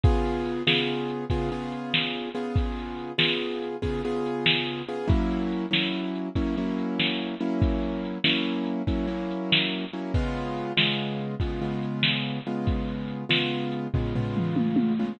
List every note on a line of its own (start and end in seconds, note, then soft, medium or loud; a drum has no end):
0.04 0.63 C#3 medium
0.04 0.63 B3 medium
0.04 0.63 F4 loud
0.04 0.63 G#4 loud
0.04 kick loud
0.04 closed hi-hat medium
0.25 closed hi-hat medium
0.46 closed hi-hat medium
0.67 1.25 C#3 medium
0.67 1.25 B3 medium
0.67 1.25 F4 medium
0.67 1.25 G#4 medium
0.67 snare loud
0.88 closed hi-hat medium
1.09 closed hi-hat medium
1.30 1.50 C#3 medium
1.30 1.50 B3 medium
1.30 1.50 F4 medium
1.30 1.50 G#4 medium
1.30 kick medium
1.30 closed hi-hat loud
1.51 2.29 C#3 medium
1.51 2.29 B3 medium
1.51 2.29 F4 medium
1.51 2.29 G#4 medium
1.51 closed hi-hat medium
1.72 closed hi-hat medium
1.94 snare medium
2.15 closed hi-hat medium
2.35 3.12 C#3 medium
2.35 3.12 B3 medium
2.35 3.12 F4 medium
2.35 3.12 G#4 medium
2.35 closed hi-hat medium
2.56 kick medium
2.56 closed hi-hat medium
2.79 closed hi-hat medium
2.99 closed hi-hat medium
3.18 3.76 C#3 medium
3.18 3.76 B3 medium
3.18 3.76 F4 medium
3.18 3.76 G#4 medium
3.18 snare loud
3.42 closed hi-hat medium
3.62 closed hi-hat medium
3.82 4.02 C#3 medium
3.82 4.02 B3 medium
3.82 4.02 F4 medium
3.82 4.02 G#4 medium
3.82 kick medium
3.82 closed hi-hat medium
4.04 4.82 C#3 medium
4.04 4.82 B3 medium
4.04 4.82 F4 medium
4.04 4.82 G#4 loud
4.04 closed hi-hat medium
4.26 closed hi-hat medium
4.46 snare loud
4.68 closed hi-hat medium
4.88 5.08 C#3 medium
4.88 5.08 B3 medium
4.88 5.08 F4 medium
4.88 5.08 G#4 medium
4.88 closed hi-hat medium
5.08 5.66 F#3 loud
5.08 5.66 A#3 loud
5.08 5.66 C#4 medium
5.08 5.66 E4 loud
5.08 kick loud
5.08 closed hi-hat medium
5.31 closed hi-hat medium
5.52 closed hi-hat medium
5.71 6.29 F#3 medium
5.71 6.29 A#3 medium
5.71 6.29 C#4 medium
5.71 6.29 E4 medium
5.71 snare medium
5.93 closed hi-hat medium
6.15 closed hi-hat medium
6.35 6.55 F#3 medium
6.35 6.55 A#3 medium
6.35 6.55 C#4 loud
6.35 6.55 E4 medium
6.35 kick medium
6.35 closed hi-hat medium
6.57 7.35 F#3 medium
6.57 7.35 A#3 medium
6.57 7.35 C#4 medium
6.57 7.35 E4 medium
6.57 closed hi-hat medium
6.78 closed hi-hat medium
6.99 snare medium
7.20 closed hi-hat medium
7.40 8.18 F#3 medium
7.40 8.18 A#3 medium
7.40 8.18 C#4 medium
7.40 8.18 E4 medium
7.40 closed hi-hat medium
7.62 kick medium
7.62 closed hi-hat medium
7.83 closed hi-hat medium
8.05 closed hi-hat medium
8.24 8.82 F#3 medium
8.24 8.82 A#3 medium
8.24 8.82 C#4 medium
8.24 8.82 E4 medium
8.24 snare loud
8.45 closed hi-hat medium
8.66 closed hi-hat medium
8.87 9.07 F#3 medium
8.87 9.07 A#3 medium
8.87 9.07 C#4 medium
8.87 9.07 E4 medium
8.87 kick medium
8.87 closed hi-hat loud
9.07 9.85 F#3 medium
9.07 9.85 A#3 medium
9.07 9.85 C#4 medium
9.07 9.85 E4 medium
9.07 closed hi-hat medium
9.31 closed hi-hat medium
9.52 snare loud
9.71 closed hi-hat medium
9.93 10.13 F#3 medium
9.93 10.13 A#3 medium
9.93 10.13 C#4 medium
9.93 10.13 E4 medium
9.93 closed hi-hat medium
10.14 10.72 C#3 loud
10.14 10.72 G#3 loud
10.14 10.72 B3 loud
10.14 10.72 F4 loud
10.14 kick medium
10.14 closed hi-hat medium
10.36 closed hi-hat medium
10.57 closed hi-hat medium
10.77 11.35 C#3 medium
10.77 11.35 G#3 loud
10.77 11.35 B3 medium
10.77 11.35 F4 medium
10.77 snare loud
10.99 closed hi-hat medium
11.20 closed hi-hat medium
11.40 11.60 C#3 medium
11.40 11.60 G#3 medium
11.40 11.60 B3 medium
11.40 11.60 F4 medium
11.40 kick medium
11.40 closed hi-hat medium
11.61 12.39 C#3 loud
11.61 12.39 G#3 medium
11.61 12.39 B3 medium
11.61 12.39 F4 medium
11.61 closed hi-hat medium
11.83 closed hi-hat medium
12.03 snare loud
12.24 closed hi-hat medium
12.45 13.24 C#3 medium
12.45 13.24 G#3 medium
12.45 13.24 B3 medium
12.45 13.24 F4 medium
12.45 closed hi-hat medium
12.67 kick medium
12.67 closed hi-hat medium
12.88 closed hi-hat medium
13.08 closed hi-hat medium
13.29 13.87 C#3 medium
13.29 13.87 G#3 medium
13.29 13.87 B3 medium
13.29 13.87 F4 medium
13.29 snare loud
13.51 closed hi-hat medium
13.72 closed hi-hat medium
13.94 14.14 C#3 medium
13.94 14.14 G#3 medium
13.94 14.14 B3 medium
13.94 14.14 F4 medium
13.94 kick medium
13.94 floor tom medium
14.15 14.93 C#3 medium
14.15 14.93 G#3 medium
14.15 14.93 B3 medium
14.15 14.93 F4 medium
14.15 floor tom medium
14.37 mid tom medium
14.56 high tom medium
14.76 high tom medium
14.99 15.19 C#3 loud
14.99 15.19 G#3 medium
14.99 15.19 B3 medium
14.99 15.19 F4 medium